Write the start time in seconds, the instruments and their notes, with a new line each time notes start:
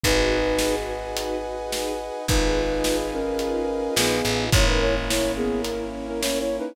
0.04 electric bass (finger) G#1, flute D#4 B4, string ensemble 1 D#4 F#4 G#4 B4, brass section B4 D#5 F#5 G#5, kick, closed hi-hat
0.47 string ensemble 1 D#4 F#4 G#4 B4
0.59 snare
1.03 string ensemble 1 D#4 F#4 G#4 B4
1.16 closed hi-hat
1.44 string ensemble 1 D#4 F#4 G#4 B4
1.59 string ensemble 1 D#4 F#4 G#4 B4
1.72 snare
2.00 string ensemble 1 D#4 F#4 G#4 B4
2.28 electric bass (finger) G#1, flute D#4 B4, string ensemble 1 D#4 F4 G#4 B4, brass section B4 D#5 F5 G#5, kick, closed hi-hat
2.70 string ensemble 1 D#4 F4 G#4 B4
2.84 snare
3.13 flute C#4 A#4
3.26 string ensemble 1 D#4 F4 G#4 B4
3.39 closed hi-hat
3.69 string ensemble 1 D#4 F4 G#4 B4
3.82 string ensemble 1 D#4 F4 G#4 B4
3.96 electric bass (finger) A#1, flute B3 G#4, snare
4.25 electric bass (finger) A1, string ensemble 1 D#4 F4 G#4 B4
4.52 electric bass (finger) G#1, brass section A#3 C#4 E4, string ensemble 1 C#4 E4 A#4, flute E4 C#5, kick, closed hi-hat
4.66 flute D#4 B4
4.81 flute E4 C#5
4.95 string ensemble 1 C#4 E4 A#4
5.09 flute E4 C#5, snare
5.36 flute B3 G#4
5.50 string ensemble 1 C#4 E4 A#4
5.64 closed hi-hat
5.93 string ensemble 1 C#4 E4 A#4
6.07 string ensemble 1 C#4 E4 A#4, flute C#4 A#4
6.21 flute E4 C#5, snare
6.39 flute E4 C#5
6.49 string ensemble 1 C#4 E4 A#4
6.59 flute D#4 B4